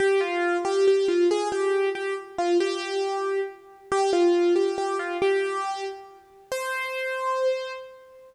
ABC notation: X:1
M:6/8
L:1/8
Q:3/8=92
K:C
V:1 name="Acoustic Grand Piano"
G F2 G G F | _A G2 G z F | G4 z2 | G F2 G G F |
G3 z3 | c6 |]